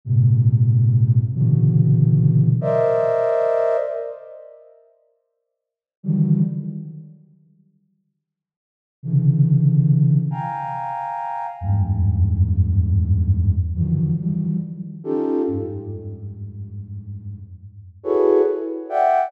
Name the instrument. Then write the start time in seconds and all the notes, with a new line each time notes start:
flute
0.05 G#2 A#2 C3
1.34 A#2 B2 C#3 D3 E3 F#3
2.61 A#4 C5 D5 D#5 E5
6.03 D3 D#3 E3 F#3 G3
9.03 C3 C#3 D3 E3
10.31 F5 G5 G#5 A#5
11.61 E2 F2 F#2 G2 G#2
13.75 D3 D#3 E3 F3 F#3
14.19 D#3 E3 F3 F#3 G3
15.04 C#4 D#4 F4 G4 A4
15.47 F2 G2 G#2
18.04 E4 F#4 G#4 A4 B4 C#5
18.89 D5 E5 F#5 G5